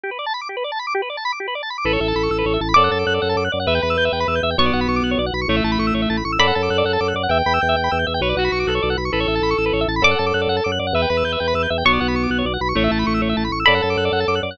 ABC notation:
X:1
M:6/8
L:1/16
Q:3/8=132
K:Amix
V:1 name="Pizzicato Strings"
z12 | z12 | z12 | d'12 |
z12 | c'12 | z12 | b12 |
z12 | z12 | z12 | d'12 |
z12 | c'12 | z12 | b12 |]
V:2 name="Clarinet"
z12 | z12 | A10 z2 | A10 z2 |
B10 z2 | B,8 z4 | A,10 z2 | A10 z2 |
g10 z2 | B2 F4 A4 z2 | A10 z2 | A10 z2 |
B10 z2 | B,8 z4 | A,10 z2 | A10 z2 |]
V:3 name="Drawbar Organ"
G B d a b d' G B d a b d' | G B d a b d' G B d a b d' | B c e a b c' e' B c e a b | d f a d' f' d f a d' f' d f |
e g b e' g' e g b e' g' e g | c d f b c' d' f' c d f b c' | c e a b c' e' c e a b c' e' | d f a d' f' d f a d' f' d f |
e g b e' g' e g b e' g' e g | c d f b c' d' f' c d f b c' | B c e a b c' e' B c e a b | d f a d' f' d f a d' f' d f |
e g b e' g' e g b e' g' e g | c d f b c' d' f' c d f b c' | c e a b c' e' c e a b c' e' | d f a d' f' d f a d' f' d f |]
V:4 name="Drawbar Organ" clef=bass
z12 | z12 | A,,,2 A,,,2 A,,,2 A,,,2 A,,,2 A,,,2 | F,,2 F,,2 F,,2 F,,2 F,,2 F,,2 |
E,,2 E,,2 E,,2 E,,2 E,,2 E,,2 | B,,,2 B,,,2 B,,,2 B,,,2 B,,,2 B,,,2 | A,,,2 A,,,2 A,,,2 A,,,2 A,,,2 A,,,2 | F,,2 F,,2 F,,2 F,,2 F,,2 F,,2 |
E,,2 E,,2 E,,2 E,,2 E,,2 E,,2 | B,,,2 B,,,2 B,,,2 B,,,2 B,,,2 B,,,2 | A,,,2 A,,,2 A,,,2 A,,,2 A,,,2 A,,,2 | F,,2 F,,2 F,,2 F,,2 F,,2 F,,2 |
E,,2 E,,2 E,,2 E,,2 E,,2 E,,2 | B,,,2 B,,,2 B,,,2 B,,,2 B,,,2 B,,,2 | A,,,2 A,,,2 A,,,2 A,,,2 A,,,2 A,,,2 | F,,2 F,,2 F,,2 F,,2 F,,2 F,,2 |]